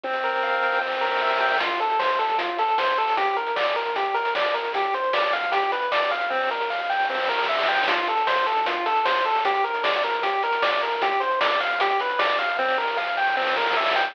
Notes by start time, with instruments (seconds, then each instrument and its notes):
0.04 lead 1 (square) C4, kick, snare
0.13 snare
0.23 lead 1 (square) A#4, snare
0.33 snare
0.43 lead 1 (square) F5, snare
0.53 snare
0.62 lead 1 (square) G5, snare
0.72 snare
0.81 lead 1 (square) C4, snare
0.87 snare
0.92 snare
0.97 snare
1.01 lead 1 (square) A#4, snare
1.06 snare
1.11 snare
1.16 snare
1.21 lead 1 (square) E5, snare
1.26 snare
1.31 snare
1.36 snare
1.41 lead 1 (square) G5, snare
1.46 snare
1.51 snare
1.55 snare
1.60 lead 1 (square) F4, kick, closed hi-hat
1.70 closed hi-hat
1.80 lead 1 (square) A4, closed hi-hat
1.90 closed hi-hat
1.99 lead 1 (square) C5, snare
2.09 kick, closed hi-hat
2.19 lead 1 (square) A4, snare, closed hi-hat
2.29 kick, closed hi-hat
2.38 lead 1 (square) F4, kick, closed hi-hat
2.49 closed hi-hat
2.58 lead 1 (square) A4, closed hi-hat
2.68 closed hi-hat
2.78 lead 1 (square) C5, snare
2.88 closed hi-hat
2.98 lead 1 (square) A4, closed hi-hat
3.07 open hi-hat
3.17 lead 1 (square) G4, kick, closed hi-hat
3.27 closed hi-hat
3.36 lead 1 (square) A#4, closed hi-hat
3.47 closed hi-hat
3.56 lead 1 (square) D5, snare
3.66 closed hi-hat
3.76 lead 1 (square) A#4, snare, closed hi-hat
3.86 kick, closed hi-hat
3.96 lead 1 (square) G4, kick, closed hi-hat
4.05 closed hi-hat
4.14 lead 1 (square) A#4, closed hi-hat
4.25 closed hi-hat
4.35 lead 1 (square) D5, snare
4.45 closed hi-hat
4.54 lead 1 (square) A#4, closed hi-hat
4.64 closed hi-hat
4.74 lead 1 (square) G4, kick, closed hi-hat
4.84 closed hi-hat
4.94 lead 1 (square) C5, closed hi-hat
5.04 closed hi-hat
5.13 lead 1 (square) D5, snare
5.23 closed hi-hat
5.33 lead 1 (square) F5, snare, closed hi-hat
5.43 kick, closed hi-hat
5.52 lead 1 (square) G4, kick, closed hi-hat
5.62 closed hi-hat
5.72 lead 1 (square) B4, closed hi-hat
5.82 closed hi-hat
5.92 lead 1 (square) D5, snare
6.02 closed hi-hat
6.11 lead 1 (square) F5, closed hi-hat
6.21 closed hi-hat
6.30 lead 1 (square) C4, kick, snare
6.41 snare
6.51 lead 1 (square) A#4, snare
6.60 snare
6.70 lead 1 (square) F5, snare
6.80 snare
6.89 lead 1 (square) G5, snare
7.00 snare
7.09 lead 1 (square) C4, snare
7.14 snare
7.19 snare
7.24 snare
7.29 lead 1 (square) A#4, snare
7.34 snare
7.39 snare
7.44 snare
7.49 lead 1 (square) E5, snare
7.53 snare
7.58 snare
7.63 snare
7.68 lead 1 (square) G5, snare
7.73 snare
7.78 snare
7.83 snare
7.88 lead 1 (square) F4, kick, closed hi-hat
7.98 closed hi-hat
8.07 lead 1 (square) A4, closed hi-hat
8.17 closed hi-hat
8.27 lead 1 (square) C5, snare
8.37 kick, closed hi-hat
8.46 lead 1 (square) A4, snare, closed hi-hat
8.56 kick, closed hi-hat
8.66 lead 1 (square) F4, kick, closed hi-hat
8.76 closed hi-hat
8.86 lead 1 (square) A4, closed hi-hat
8.96 closed hi-hat
9.05 lead 1 (square) C5, snare
9.15 closed hi-hat
9.25 lead 1 (square) A4, closed hi-hat
9.35 open hi-hat
9.45 lead 1 (square) G4, kick, closed hi-hat
9.54 closed hi-hat
9.64 lead 1 (square) A#4, closed hi-hat
9.74 closed hi-hat
9.84 lead 1 (square) D5, snare
9.94 closed hi-hat
10.04 lead 1 (square) A#4, snare, closed hi-hat
10.13 kick, closed hi-hat
10.23 lead 1 (square) G4, kick, closed hi-hat
10.33 closed hi-hat
10.43 lead 1 (square) A#4, closed hi-hat
10.53 closed hi-hat
10.62 lead 1 (square) D5, snare
10.72 closed hi-hat
10.82 lead 1 (square) A#4, closed hi-hat
10.92 closed hi-hat
11.02 lead 1 (square) G4, kick, closed hi-hat
11.11 closed hi-hat
11.20 lead 1 (square) C5, closed hi-hat
11.31 closed hi-hat
11.41 lead 1 (square) D5, snare
11.51 closed hi-hat
11.60 lead 1 (square) F5, snare, closed hi-hat
11.70 kick, closed hi-hat
11.80 lead 1 (square) G4, kick, closed hi-hat
11.90 closed hi-hat
12.00 lead 1 (square) B4, closed hi-hat
12.09 closed hi-hat
12.19 lead 1 (square) D5, snare
12.29 closed hi-hat
12.39 lead 1 (square) F5, closed hi-hat
12.49 closed hi-hat
12.58 lead 1 (square) C4, kick, snare
12.68 snare
12.78 lead 1 (square) A#4, snare
12.88 snare
12.97 lead 1 (square) F5, snare
13.07 snare
13.17 lead 1 (square) G5, snare
13.27 snare
13.37 lead 1 (square) C4, snare
13.42 snare
13.47 snare
13.52 snare
13.56 lead 1 (square) A#4, snare
13.61 snare
13.66 snare
13.71 snare
13.76 lead 1 (square) E5, snare
13.81 snare
13.86 snare
13.91 snare
13.96 lead 1 (square) G5, snare
14.01 snare
14.05 snare
14.10 snare